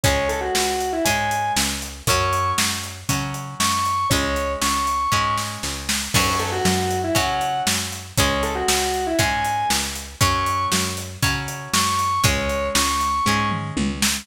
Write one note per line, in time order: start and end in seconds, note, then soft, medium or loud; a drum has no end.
0.03 0.50 C#2 loud
0.03 0.96 G#3 loud
0.03 0.96 C#4 loud
0.03 0.28 C#5 medium
0.03 kick loud
0.03 closed hi-hat loud
0.28 0.40 A4 medium
0.28 closed hi-hat medium
0.41 0.90 F#4 medium
0.55 1.01 C#2 medium
0.55 snare loud
0.81 closed hi-hat medium
0.92 1.05 E4 medium
1.05 1.51 G#2 medium
1.05 1.97 G#3 medium
1.05 1.97 C#4 medium
1.05 1.52 G#5 medium
1.05 kick medium
1.05 closed hi-hat loud
1.31 closed hi-hat medium
1.56 2.02 C#2 medium
1.56 snare loud
1.82 closed hi-hat medium
2.07 2.53 F#2 loud
2.07 3.00 F#3 loud
2.07 3.00 C#4 loud
2.07 2.50 C#6 medium
2.07 kick loud
2.07 closed hi-hat loud
2.33 closed hi-hat medium
2.58 3.04 F#2 medium
2.58 snare loud
2.83 closed hi-hat medium
3.09 3.55 C#3 medium
3.09 4.01 F#3 medium
3.09 4.01 C#4 medium
3.09 kick medium
3.09 closed hi-hat medium
3.34 closed hi-hat medium
3.60 4.06 F#2 medium
3.60 4.07 C#6 medium
3.60 snare loud
3.85 closed hi-hat medium
4.10 4.56 C#2 loud
4.10 5.03 G#3 loud
4.10 5.03 C#4 loud
4.10 4.52 C#5 medium
4.10 kick loud
4.10 closed hi-hat medium
4.36 closed hi-hat medium
4.61 5.07 C#2 medium
4.61 5.34 C#6 medium
4.61 snare loud
4.87 closed hi-hat medium
5.12 5.58 G#2 medium
5.12 6.03 G#3 loud
5.12 6.03 C#4 medium
5.12 kick medium
5.38 snare medium
5.63 6.09 C#2 medium
5.63 snare medium
5.89 snare loud
6.14 6.60 F#2 loud
6.14 7.07 F#3 loud
6.14 7.07 C#4 loud
6.14 6.37 C#6 medium
6.14 kick loud
6.14 crash loud
6.39 6.51 A4 medium
6.39 closed hi-hat medium
6.52 6.99 F#4 medium
6.65 7.11 F#2 medium
6.65 snare loud
6.90 closed hi-hat medium
7.04 7.16 E4 medium
7.15 7.62 C#3 medium
7.15 8.06 F#3 loud
7.15 8.06 C#4 loud
7.15 7.59 F#5 medium
7.15 kick medium
7.15 closed hi-hat medium
7.41 closed hi-hat medium
7.67 8.12 F#2 medium
7.67 snare loud
7.92 closed hi-hat medium
8.17 8.63 C#2 loud
8.17 9.10 G#3 loud
8.17 9.10 C#4 loud
8.17 8.42 C#5 medium
8.17 kick loud
8.17 closed hi-hat loud
8.43 8.55 A4 medium
8.43 closed hi-hat medium
8.55 9.04 F#4 medium
8.68 9.14 C#2 medium
8.68 snare loud
8.94 closed hi-hat medium
9.07 9.19 E4 medium
9.19 9.65 G#2 medium
9.19 10.10 G#3 loud
9.19 10.10 C#4 loud
9.19 9.69 G#5 medium
9.19 kick medium
9.19 closed hi-hat medium
9.44 closed hi-hat medium
9.70 10.16 C#2 medium
9.70 snare loud
9.95 closed hi-hat medium
10.21 10.67 F#2 loud
10.21 11.12 F#3 loud
10.21 11.12 C#4 loud
10.21 10.65 C#6 loud
10.21 kick loud
10.21 closed hi-hat loud
10.46 closed hi-hat medium
10.72 11.18 F#2 medium
10.72 snare loud
10.97 closed hi-hat medium
11.22 11.68 C#3 medium
11.22 12.14 F#3 medium
11.22 12.14 C#4 loud
11.22 kick loud
11.22 closed hi-hat medium
11.48 closed hi-hat medium
11.73 12.19 F#2 medium
11.73 12.20 C#6 medium
11.73 snare loud
11.99 closed hi-hat medium
12.24 12.70 C#2 loud
12.24 13.15 G#3 loud
12.24 13.15 C#4 loud
12.24 12.67 C#5 medium
12.24 kick loud
12.24 closed hi-hat loud
12.49 closed hi-hat medium
12.75 13.21 C#2 loud
12.75 13.48 C#6 medium
12.75 snare loud
13.01 closed hi-hat medium
13.26 13.72 G#2 loud
13.26 14.19 G#3 medium
13.26 14.19 C#4 loud
13.26 kick medium
13.51 mid tom medium
13.77 14.23 C#2 medium
13.77 high tom medium
14.02 snare loud